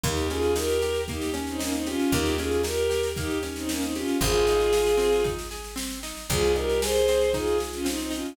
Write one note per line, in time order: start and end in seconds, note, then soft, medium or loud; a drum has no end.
0.03 1.96 D#2 loud
0.03 0.27 A#3 medium
0.03 0.28 D#4 medium
0.03 0.28 G4 medium
0.03 kick loud
0.03 snare medium
0.17 snare medium
0.30 0.54 C#4 medium
0.30 0.53 F4 medium
0.30 0.53 G#4 medium
0.30 snare medium
0.42 snare medium
0.55 0.79 D#4 medium
0.55 1.02 G4 medium
0.55 1.02 A#4 medium
0.55 snare medium
0.69 snare medium
0.82 1.06 G4 medium
0.82 snare medium
0.94 snare medium
1.08 1.33 A#3 medium
1.08 1.31 D#4 medium
1.08 1.31 G4 medium
1.08 kick medium
1.08 snare medium
1.21 snare medium
1.34 1.57 C#4 medium
1.34 snare medium
1.47 1.60 C4 medium
1.47 1.60 D#4 medium
1.47 snare medium
1.59 1.72 A#3 medium
1.59 1.72 C#4 medium
1.59 1.83 D#4 medium
1.59 snare medium
1.73 1.86 C4 medium
1.73 1.86 D#4 medium
1.73 snare medium
1.86 2.11 C#4 medium
1.86 2.11 F4 medium
1.86 2.10 G4 medium
1.86 snare medium
1.99 snare medium
2.12 4.04 D#2 loud
2.12 2.37 A#3 medium
2.12 2.34 D#4 medium
2.12 2.34 G4 medium
2.12 kick medium
2.12 snare medium
2.25 snare medium
2.38 2.63 C#4 medium
2.38 2.61 F4 medium
2.38 2.61 G#4 medium
2.38 snare medium
2.51 snare medium
2.63 2.87 D#4 medium
2.63 3.08 G4 medium
2.63 3.08 A#4 medium
2.63 snare medium
2.78 snare medium
2.90 3.13 G4 medium
2.90 snare medium
3.03 snare medium
3.16 3.41 A#3 medium
3.16 3.38 D#4 medium
3.16 3.38 G4 medium
3.16 kick medium
3.16 snare medium
3.30 snare medium
3.43 3.66 C#4 medium
3.43 snare medium
3.56 3.68 C4 medium
3.56 3.68 D#4 medium
3.56 snare medium
3.69 3.82 A#3 medium
3.69 3.82 C#4 medium
3.69 3.92 D#4 medium
3.69 snare medium
3.82 3.94 C4 medium
3.82 3.94 D#4 medium
3.82 snare medium
3.95 4.17 C#4 medium
3.95 4.17 F4 medium
3.95 4.19 G4 medium
3.95 snare medium
4.08 snare medium
4.21 6.13 G#1 loud
4.21 4.44 C4 medium
4.21 5.22 F4 medium
4.21 5.22 G#4 loud
4.21 kick medium
4.21 snare medium
4.34 snare medium
4.47 4.72 D#4 medium
4.47 snare medium
4.60 snare medium
4.72 4.97 G#4 medium
4.72 snare medium
4.86 snare medium
4.97 5.21 C4 medium
4.97 snare medium
5.12 snare medium
5.24 5.48 D#4 medium
5.24 kick medium
5.24 snare medium
5.39 snare medium
5.51 5.74 G#4 medium
5.51 snare medium
5.64 snare medium
5.76 5.99 C4 medium
5.76 snare medium
5.91 snare medium
6.03 6.27 D#4 medium
6.03 snare medium
6.17 snare medium
6.29 8.22 C2 loud
6.29 6.54 C4 medium
6.29 6.53 F4 medium
6.29 6.53 G#4 medium
6.29 kick loud
6.29 snare medium
6.43 snare medium
6.56 6.79 D#4 medium
6.56 6.80 G4 medium
6.56 6.80 A#4 medium
6.56 snare medium
6.69 snare medium
6.82 7.30 G#4 medium
6.82 7.06 G#4 medium
6.82 7.30 C5 medium
6.82 snare loud
6.95 snare medium
7.08 7.32 C4 medium
7.08 snare medium
7.21 snare medium
7.33 7.57 D#4 medium
7.33 7.58 F4 medium
7.33 7.58 G#4 medium
7.33 kick medium
7.33 snare medium
7.47 snare medium
7.58 7.82 G#4 medium
7.58 snare medium
7.73 7.86 C#4 medium
7.73 7.86 F4 medium
7.73 snare medium
7.85 8.08 C4 medium
7.85 7.99 C4 medium
7.85 7.99 D#4 medium
7.85 snare medium
7.99 8.12 C4 medium
7.99 8.12 D#4 medium
7.99 snare medium
8.11 8.34 C#4 medium
8.11 8.34 D#4 medium
8.11 8.34 F4 medium
8.11 snare medium
8.25 snare medium